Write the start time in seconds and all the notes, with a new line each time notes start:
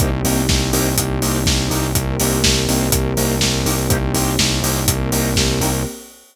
0.00 C2 A#3 C4 D#4 G4, kick, closed hi-hat
0.24 C2 A#3 C4 D#4 G4, open hi-hat
0.49 C2, kick, snare
0.73 C2 A#3 C4 D#4 G4, open hi-hat
0.97 C2, kick, closed hi-hat
1.22 C2 A#3 C4 D#4 G4, open hi-hat
1.46 C2, kick, snare
1.70 C2 A#3 C4 D#4 G4, open hi-hat
1.95 C2 A#3 C4 G4 A#4, kick, closed hi-hat
2.20 C2 A#3 C4 D#4 G4, open hi-hat
2.44 C2, kick, snare
2.68 C2 A#3 C4 D#4 G4, open hi-hat
2.92 C2, kick, closed hi-hat
3.17 C2 A#3 C4 D#4 G4, open hi-hat
3.41 C2, kick, snare
3.66 C2 A#3 C4 D#4 G4, open hi-hat
3.89 C2 A#3 C4 D#4 G4, kick, closed hi-hat
4.14 C2 A#3 C4 D#4 G4, open hi-hat
4.39 C2, kick, snare
4.63 C2 A#3 C4 D#4 G4, open hi-hat
4.87 C2 A#3 C4 G4 A#4, kick, closed hi-hat
5.12 C2 A#3 C4 D#4 G4, open hi-hat
5.36 C2, kick, snare
5.61 C2 A#3 C4 D#4 G4, open hi-hat